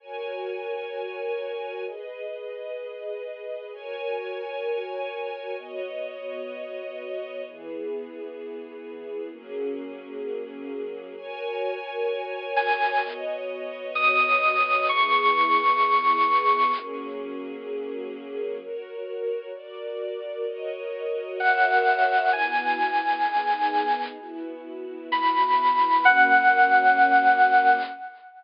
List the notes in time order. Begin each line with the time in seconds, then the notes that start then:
0.00 F#4 A#4 C#5 G#5
1.86 G#4 B4 D#5
3.72 F#4 A#4 C#5 G#5
5.58 B3 F#4 C#5 D#5
7.45 E3 B3 G#4
9.31 F#3 A#3 C#4 G#4
11.17 F#4 A#4 C#5 G#5
12.56 G#5
13.03 B3 F#4 C#5 D#5
13.95 D#6
14.87 E3 B3 G#4 C#6
16.75 F#3 A#3 C#4 G#4
18.61 F#4 A#4 C#5
19.54 F#4 A#4 D5
20.46 F#4 A#4 C#5 D#5
21.40 F#4 A#4 C#5 E5 F#5
22.32 B3 E4 F#4 G#5
23.25 B3 D#4 G#4
24.19 B3 E4 F#4
25.12 E3 B3 F#4 B5
26.04 F#3 A#3 C#4 F#5